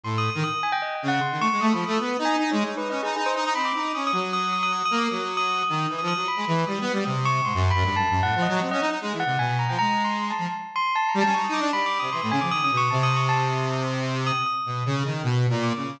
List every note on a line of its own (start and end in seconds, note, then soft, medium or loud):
0.04 0.30 A2 medium
0.04 0.16 C6 medium
0.18 0.30 D#6 medium
0.30 0.42 D#6 medium
0.35 0.44 D#3 medium
0.44 0.61 D#6 loud
0.63 0.72 G#5 medium
0.72 0.81 G5 loud
0.82 0.94 D#5 medium
0.95 1.07 G5 medium
1.03 1.20 C#3 medium
1.08 1.20 F#5 loud
1.21 1.39 C6 medium
1.31 1.40 D#3 medium
1.40 1.49 A3 medium
1.40 1.59 C#6 loud
1.52 1.61 G#3 medium
1.61 1.73 A3 medium
1.61 1.73 D#6 medium
1.73 1.84 F3 medium
1.73 1.85 B5 medium
1.86 1.98 A3 loud
1.86 1.98 D#6 medium
1.99 2.17 B3 medium
1.99 2.23 D#6 medium
2.19 2.36 D#4 loud
2.25 2.48 G#5 loud
2.39 2.51 D#4 loud
2.51 2.64 G#3 loud
2.51 2.75 C#5 medium
2.64 2.75 D#4 medium
2.77 2.88 D#4 medium
2.77 2.89 B4 medium
2.90 3.01 C#4 medium
2.90 3.02 D#5 medium
3.03 3.15 D#4 medium
3.03 3.15 G#4 medium
3.16 3.33 D#4 medium
3.16 3.25 G#4 medium
3.26 3.35 C5 medium
3.36 3.44 D#4 loud
3.36 3.53 D#5 medium
3.45 3.54 D#4 loud
3.55 3.72 C4 medium
3.55 3.64 B5 medium
3.65 3.91 D6 medium
3.75 3.92 D#4 medium
3.94 4.12 C#4 medium
3.94 4.06 D#6 medium
4.07 4.19 D#6 loud
4.12 4.83 F#3 medium
4.20 4.32 D#6 medium
4.33 4.51 D#6 loud
4.53 4.62 D#6 medium
4.63 4.72 D#6 loud
4.73 4.84 D#6 medium
4.85 4.97 D#6 loud
4.91 5.08 A#3 loud
4.98 5.10 D6 medium
5.10 5.63 F#3 medium
5.10 5.35 D#6 medium
5.37 5.60 D#6 loud
5.63 5.87 D#6 medium
5.69 5.87 D#3 medium
5.89 6.01 E3 medium
5.98 6.14 F3 medium
5.98 6.07 D#6 medium
6.08 6.25 D#6 loud
6.16 6.27 F#3 medium
6.28 6.63 B5 medium
6.36 6.45 G#3 medium
6.47 6.65 E3 medium
6.67 6.79 G3 medium
6.67 7.02 D#6 medium
6.81 6.92 B3 loud
6.93 7.04 G3 medium
7.05 7.41 C3 medium
7.05 7.23 D#6 medium
7.25 7.43 C#6 loud
7.45 7.53 G#2 medium
7.45 7.68 C6 medium
7.54 7.72 F#2 loud
7.71 7.94 B5 loud
7.75 7.84 F#2 loud
7.84 7.96 G2 medium
7.96 8.08 F#2 medium
7.96 8.20 A5 loud
8.10 8.22 F#2 medium
8.23 8.35 A2 medium
8.23 8.41 F#5 loud
8.35 8.47 F3 medium
8.42 8.60 D#5 medium
8.48 8.60 F#3 loud
8.61 8.70 C4 medium
8.61 8.71 F#5 medium
8.71 8.81 C#4 loud
8.71 8.80 D#5 loud
8.81 8.90 D#4 loud
8.90 8.99 D#4 medium
9.01 9.13 G#3 medium
9.12 9.24 E3 medium
9.20 9.37 F#5 loud
9.26 9.38 C3 medium
9.39 9.65 B2 medium
9.39 9.57 G#5 medium
9.59 9.68 A#5 medium
9.69 9.78 F3 medium
9.69 9.78 G5 medium
9.79 10.32 G#3 medium
9.79 10.02 A#5 loud
10.05 10.28 C6 medium
10.30 10.54 A5 medium
10.38 10.47 F3 medium
10.76 10.93 C6 loud
10.96 11.07 A5 loud
11.09 11.20 A#5 medium
11.14 11.23 G3 loud
11.21 11.33 A5 loud
11.26 11.35 C#4 loud
11.34 11.47 D#4 medium
11.34 11.43 C#6 medium
11.44 11.53 D#6 medium
11.49 11.60 D#4 loud
11.54 11.62 D6 medium
11.60 11.71 D4 loud
11.72 11.99 G3 medium
11.72 11.85 B5 loud
11.86 11.98 D6 medium
11.99 12.10 C3 medium
11.99 12.11 D#6 medium
12.12 12.21 E3 medium
12.12 12.21 C6 medium
12.22 12.31 A2 medium
12.22 12.31 D#6 medium
12.31 12.40 C#3 medium
12.31 12.40 G#5 loud
12.41 12.51 F3 medium
12.41 12.50 D6 medium
12.51 12.61 D#3 medium
12.51 12.63 D#6 loud
12.62 12.71 C#3 medium
12.62 12.76 D#6 medium
12.71 12.89 B2 medium
12.77 12.89 C#6 loud
12.90 14.32 C3 loud
12.90 13.02 A5 medium
13.03 13.15 D#6 loud
13.16 13.28 C#6 medium
13.29 13.38 A5 loud
13.39 13.83 D#6 medium
14.27 14.44 D#6 loud
14.46 14.99 D#6 medium
14.66 14.83 B2 medium
14.86 15.03 C#3 loud
15.05 15.22 D#3 medium
15.24 15.47 B2 loud
15.50 15.73 A#2 loud
15.63 15.98 D6 medium
15.76 15.99 C#3 medium